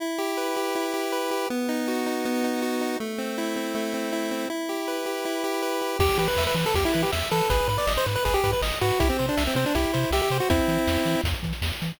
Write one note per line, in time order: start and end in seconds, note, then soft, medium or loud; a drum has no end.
0.00 0.75 E4 medium
0.18 0.56 G4 medium
0.37 1.12 B4 medium
0.56 0.93 G4 medium
0.75 1.47 E4 medium
0.94 1.31 G4 medium
1.12 1.48 B4 medium
1.31 1.49 G4 medium
1.50 2.25 B3 medium
1.69 2.06 D#4 medium
1.88 2.62 F#4 medium
2.06 2.44 D#4 medium
2.25 2.97 B3 medium
2.44 2.81 D#4 medium
2.62 2.98 F#4 medium
2.81 2.99 D#4 medium
3.00 3.74 A3 medium
3.18 3.56 C4 medium
3.38 4.12 E4 medium
3.56 3.93 C4 medium
3.75 4.46 A3 medium
3.94 4.31 C4 medium
4.12 4.48 E4 medium
4.31 4.49 C4 medium
4.50 5.25 E4 medium
4.69 5.05 G4 medium
4.88 5.62 B4 medium
5.06 5.43 G4 medium
5.25 5.97 E4 medium
5.44 5.81 G4 medium
5.62 5.98 B4 medium
5.81 5.99 G4 medium
5.99 6.10 E2 medium
5.99 6.18 G4 loud
5.99 6.17 G4 medium
5.99 kick medium
5.99 crash medium
6.09 closed hi-hat medium
6.18 6.28 E3 medium
6.18 6.27 G4 medium
6.18 6.36 B4 medium
6.18 closed hi-hat medium
6.28 6.44 B4 medium
6.28 closed hi-hat medium
6.37 6.47 E2 medium
6.37 6.55 E5 medium
6.37 snare medium
6.47 6.56 B4 medium
6.47 closed hi-hat medium
6.55 6.65 E3 medium
6.55 6.73 B4 medium
6.55 closed hi-hat medium
6.66 6.75 A4 medium
6.66 closed hi-hat medium
6.74 6.85 E2 medium
6.74 6.92 G4 medium
6.74 6.84 G4 medium
6.74 kick medium
6.74 closed hi-hat medium
6.85 7.03 E4 loud
6.85 closed hi-hat medium
6.94 7.05 E3 medium
6.94 7.10 B4 medium
6.94 closed hi-hat medium
7.03 7.11 G4 medium
7.03 closed hi-hat medium
7.12 7.23 E2 medium
7.12 7.29 E5 medium
7.12 snare medium
7.22 closed hi-hat medium
7.31 7.42 E3 medium
7.31 7.49 A4 medium
7.31 7.48 B4 medium
7.31 closed hi-hat medium
7.41 closed hi-hat medium
7.50 7.61 G#1 loud
7.50 7.67 G#4 medium
7.50 7.68 B4 loud
7.50 kick medium
7.50 closed hi-hat medium
7.59 closed hi-hat medium
7.68 7.78 G#2 medium
7.68 7.77 B4 medium
7.68 7.86 B4 medium
7.68 closed hi-hat medium
7.78 7.93 D5 medium
7.78 closed hi-hat medium
7.87 7.98 G#1 medium
7.87 8.04 D#5 medium
7.87 snare medium
7.97 8.06 C5 medium
7.97 closed hi-hat medium
8.06 8.17 G#2 medium
8.06 8.23 B4 medium
8.06 closed hi-hat medium
8.16 8.24 B4 medium
8.16 closed hi-hat medium
8.25 8.36 G#1 medium
8.25 8.42 G#4 medium
8.25 8.34 B4 medium
8.25 kick medium
8.25 closed hi-hat medium
8.34 8.51 G4 loud
8.34 closed hi-hat medium
8.44 8.54 G#2 medium
8.44 8.60 B4 medium
8.44 kick medium
8.44 closed hi-hat medium
8.53 8.62 B4 medium
8.53 closed hi-hat medium
8.62 8.72 G#1 medium
8.62 8.79 D#5 medium
8.62 snare medium
8.72 closed hi-hat medium
8.81 8.92 G#2 medium
8.81 9.00 F#4 medium
8.81 8.98 B4 medium
8.81 closed hi-hat medium
8.90 closed hi-hat medium
9.00 9.11 C2 loud
9.00 9.09 E4 loud
9.00 9.17 G4 medium
9.00 kick medium
9.00 closed hi-hat medium
9.09 9.26 C4 medium
9.09 closed hi-hat medium
9.19 9.30 C3 medium
9.19 9.36 C5 medium
9.19 closed hi-hat medium
9.28 9.44 D4 medium
9.28 closed hi-hat medium
9.37 9.48 C2 medium
9.37 9.54 E5 medium
9.37 snare medium
9.47 9.56 C4 medium
9.47 closed hi-hat medium
9.55 9.65 C3 medium
9.55 9.65 C4 medium
9.55 9.73 C5 medium
9.55 closed hi-hat medium
9.66 9.75 D4 medium
9.66 closed hi-hat medium
9.75 9.86 C2 medium
9.75 10.12 E4 medium
9.75 9.92 G4 medium
9.75 kick medium
9.75 closed hi-hat medium
9.84 closed hi-hat medium
9.93 10.05 C3 medium
9.93 10.10 C5 medium
9.93 closed hi-hat medium
10.03 closed hi-hat medium
10.11 10.21 C2 medium
10.11 10.21 G4 medium
10.11 10.29 E5 medium
10.11 snare medium
10.22 10.38 G4 medium
10.22 closed hi-hat medium
10.30 10.41 C3 medium
10.30 10.48 C5 medium
10.30 closed hi-hat medium
10.40 10.49 F#4 medium
10.40 closed hi-hat soft
10.50 10.61 E2 medium
10.50 11.21 C4 medium
10.50 11.21 E4 loud
10.50 kick medium
10.50 closed hi-hat medium
10.59 closed hi-hat medium
10.68 10.78 E3 medium
10.68 closed hi-hat medium
10.78 closed hi-hat soft
10.88 10.98 E2 medium
10.88 snare medium
10.97 closed hi-hat medium
11.05 11.16 E3 medium
11.05 closed hi-hat medium
11.15 closed hi-hat medium
11.24 11.34 E2 medium
11.24 kick medium
11.24 closed hi-hat medium
11.34 closed hi-hat medium
11.43 11.53 E3 medium
11.43 kick medium
11.43 closed hi-hat medium
11.53 closed hi-hat medium
11.62 11.72 E2 medium
11.62 snare medium
11.72 closed hi-hat soft
11.82 11.92 E3 medium
11.82 closed hi-hat medium
11.90 closed hi-hat medium